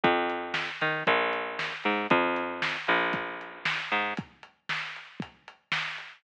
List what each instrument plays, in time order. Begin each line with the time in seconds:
0.03 electric bass (finger) F2, kick, closed hi-hat
0.30 closed hi-hat
0.54 snare
0.81 electric bass (finger) D#3, closed hi-hat
1.07 electric bass (finger) A#1, kick, closed hi-hat
1.33 closed hi-hat
1.59 snare
1.84 electric bass (finger) G#2, closed hi-hat
2.10 electric bass (finger) F2, kick, closed hi-hat
2.36 closed hi-hat
2.62 snare
2.87 electric bass (finger) A#1, closed hi-hat
3.13 kick, closed hi-hat
3.41 closed hi-hat
3.65 snare
3.91 electric bass (finger) G#2, closed hi-hat
4.17 kick, closed hi-hat
4.43 closed hi-hat
4.69 snare
4.96 closed hi-hat
5.20 kick, closed hi-hat
5.48 closed hi-hat
5.72 snare
5.98 closed hi-hat